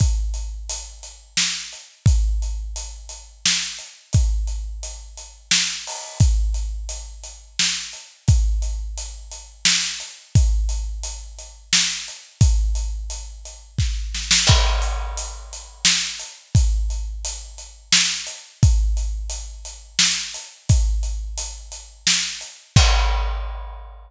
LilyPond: \new DrumStaff \drummode { \time 3/4 \tempo 4 = 87 <hh bd>8 hh8 hh8 hh8 sn8 hh8 | <hh bd>8 hh8 hh8 hh8 sn8 hh8 | <hh bd>8 hh8 hh8 hh8 sn8 hho8 | <hh bd>8 hh8 hh8 hh8 sn8 hh8 |
<hh bd>8 hh8 hh8 hh8 sn8 hh8 | <hh bd>8 hh8 hh8 hh8 sn8 hh8 | <hh bd>8 hh8 hh8 hh8 <bd sn>8 sn16 sn16 | <cymc bd>8 hh8 hh8 hh8 sn8 hh8 |
<hh bd>8 hh8 hh8 hh8 sn8 hh8 | <hh bd>8 hh8 hh8 hh8 sn8 hh8 | <hh bd>8 hh8 hh8 hh8 sn8 hh8 | <cymc bd>4 r4 r4 | }